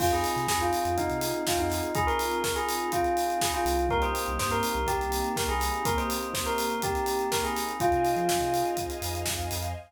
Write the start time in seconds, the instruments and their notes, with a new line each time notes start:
0.00 synth bass 2 F2, electric piano 1 C4 D#4 F4 G#4, string ensemble 1 C4 D#4 F4 G#4, tubular bells F4, kick, crash
0.12 tubular bells G#4, closed hi-hat
0.24 open hi-hat
0.36 synth bass 2 C3, closed hi-hat
0.48 synth bass 2 F2, tubular bells G#4, kick, snare
0.60 tubular bells F4, closed hi-hat
0.73 open hi-hat
0.85 synth bass 2 F2, closed hi-hat
0.98 tubular bells D#4, kick, closed hi-hat
1.10 synth bass 2 C3, closed hi-hat
1.21 open hi-hat
1.34 closed hi-hat
1.47 tubular bells F4, kick, snare
1.57 synth bass 2 F2, tubular bells D#4, closed hi-hat
1.70 snare, open hi-hat
1.83 closed hi-hat
1.95 tubular bells G#4, kick, closed hi-hat
2.07 tubular bells A#4, closed hi-hat
2.19 open hi-hat
2.32 closed hi-hat
2.44 tubular bells A#4, kick, snare
2.56 tubular bells G#4, closed hi-hat
2.69 open hi-hat
2.80 closed hi-hat
2.92 tubular bells F4, kick, closed hi-hat
3.04 closed hi-hat
3.17 open hi-hat
3.30 closed hi-hat
3.41 tubular bells G#4, kick, snare
3.53 tubular bells F4, closed hi-hat
3.65 synth bass 2 C2, snare, open hi-hat
3.79 closed hi-hat
3.89 electric piano 1 A#3 C4 D#4 G4, string ensemble 1 A#3 C4 D#4 G4, tubular bells A#4, kick, closed hi-hat
4.02 tubular bells C5, closed hi-hat
4.15 open hi-hat
4.26 synth bass 2 C2, closed hi-hat
4.39 synth bass 2 G2, tubular bells C5, kick, snare
4.51 tubular bells A#4, closed hi-hat
4.63 open hi-hat
4.74 synth bass 2 C2, closed hi-hat
4.87 tubular bells G4, kick, closed hi-hat
5.00 synth bass 2 C2, closed hi-hat
5.12 open hi-hat
5.24 closed hi-hat
5.36 tubular bells A#4, kick, snare
5.48 synth bass 2 C2, tubular bells G#4, closed hi-hat
5.60 snare, open hi-hat
5.74 closed hi-hat
5.85 electric piano 1 A#3 C4 D#4 G4, tubular bells A#4, kick, closed hi-hat
5.98 tubular bells C5, closed hi-hat
6.10 open hi-hat
6.23 closed hi-hat
6.34 tubular bells C5, kick, snare
6.46 tubular bells A#4, closed hi-hat
6.58 open hi-hat
6.70 closed hi-hat
6.82 tubular bells G4, kick, closed hi-hat
6.95 closed hi-hat
7.06 open hi-hat
7.19 closed hi-hat
7.32 tubular bells A#4, kick, snare
7.44 tubular bells G#4, closed hi-hat
7.56 snare, open hi-hat
7.69 closed hi-hat
7.80 synth bass 2 F2, electric piano 1 C4 D#4 F4 G#4, tubular bells F4, string ensemble 1 C5 D#5 F5 G#5, kick, closed hi-hat
7.92 synth bass 2 C3, closed hi-hat
8.05 open hi-hat
8.16 synth bass 2 F3, closed hi-hat
8.29 kick, snare
8.41 synth bass 2 C3, closed hi-hat
8.54 open hi-hat
8.65 closed hi-hat
8.77 kick, closed hi-hat
8.90 closed hi-hat
9.02 synth bass 2 F2, open hi-hat
9.15 closed hi-hat
9.26 synth bass 2 F2, kick, snare
9.40 closed hi-hat
9.51 synth bass 2 F2, snare, open hi-hat
9.63 snare, closed hi-hat